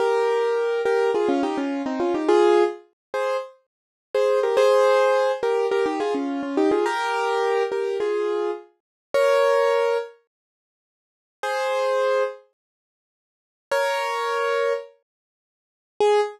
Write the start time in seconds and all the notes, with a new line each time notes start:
0.00 G4 A#4
0.85 G4 A#4
1.15 F4 G#4
1.29 C#4 F4
1.43 D#4 G4
1.58 C#4 F4
1.86 C4 D#4
2.00 C#4 F4
2.14 D#4 G4
2.28 F4 G#4
3.14 G#4 C5
4.15 G#4 C5
4.43 G4 A#4
4.57 G#4 C5
5.43 G4 A#4
5.71 G4 A#4
5.86 D#4 G4
6.00 F4 G#4
6.15 C#4 F4
6.43 C#4 F4
6.57 D#4 G4
6.71 F4 G#4
6.86 G4 A#4
7.72 G4 A#4
8.00 F4 G#4
9.14 A#4 C#5
11.43 G#4 C5
13.71 A#4 C#5
16.00 G#4